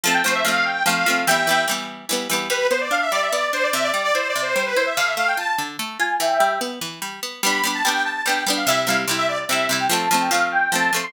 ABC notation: X:1
M:3/4
L:1/16
Q:1/4=146
K:Gmix
V:1 name="Accordion"
a g c e f2 g2 f4 | [eg]4 z8 | B2 c d f e d e d2 c d | e d2 d (3c2 d2 c2 c B c e |
f e f g a a z4 _a2 | [eg]4 z8 | b b b a g2 a2 g2 z f | e2 f z2 e d z e2 z g |
a a a g f2 g2 a2 z c' |]
V:2 name="Pizzicato Strings"
[F,A,C]2 [F,A,C]2 [F,A,C]4 [F,A,C]2 [F,A,C]2 | [E,G,B,]2 [E,G,B,]2 [E,G,B,]4 [E,G,B,]2 [E,G,B,]2 | G,2 B,2 D2 G,2 B,2 D2 | C,2 G,2 E2 C,2 G,2 E2 |
D,2 A,2 F2 D,2 A,2 F2 | E,2 G,2 B,2 E,2 G,2 B,2 | [G,B,D]2 [G,B,D]2 [G,B,D]4 [G,B,D]2 [G,B,D]2 | [C,G,E]2 [C,G,E]2 [C,G,E]4 [C,G,E]2 [C,G,E]2 |
[F,A,C]2 [F,A,C]2 [F,A,C]4 [F,A,C]2 [F,A,C]2 |]